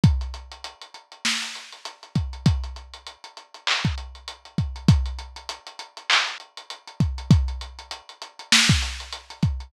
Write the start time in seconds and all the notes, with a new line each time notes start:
0.04 kick, closed hi-hat
0.21 closed hi-hat
0.34 closed hi-hat
0.52 closed hi-hat
0.64 closed hi-hat
0.82 closed hi-hat
0.94 closed hi-hat
1.12 closed hi-hat
1.25 snare
1.42 closed hi-hat
1.55 closed hi-hat
1.72 closed hi-hat
1.85 closed hi-hat
2.03 closed hi-hat
2.15 kick, closed hi-hat
2.33 closed hi-hat
2.46 kick, closed hi-hat
2.64 closed hi-hat
2.76 closed hi-hat
2.94 closed hi-hat
3.07 closed hi-hat
3.24 closed hi-hat
3.37 closed hi-hat
3.54 closed hi-hat
3.67 clap
3.85 kick, closed hi-hat
3.98 closed hi-hat
4.15 closed hi-hat
4.28 closed hi-hat
4.45 closed hi-hat
4.58 kick, closed hi-hat
4.76 closed hi-hat
4.88 kick, closed hi-hat
5.06 closed hi-hat
5.19 closed hi-hat
5.36 closed hi-hat
5.49 closed hi-hat
5.67 closed hi-hat
5.79 closed hi-hat
5.97 closed hi-hat
6.10 clap
6.27 closed hi-hat
6.40 closed hi-hat
6.57 closed hi-hat
6.70 closed hi-hat
6.88 closed hi-hat
7.00 kick, closed hi-hat
7.18 closed hi-hat
7.31 kick, closed hi-hat
7.48 closed hi-hat
7.61 closed hi-hat
7.79 closed hi-hat
7.91 closed hi-hat
8.09 closed hi-hat
8.22 closed hi-hat
8.39 closed hi-hat
8.52 snare
8.69 kick, closed hi-hat
8.82 closed hi-hat
9.00 closed hi-hat
9.13 closed hi-hat
9.30 closed hi-hat
9.43 kick, closed hi-hat
9.60 closed hi-hat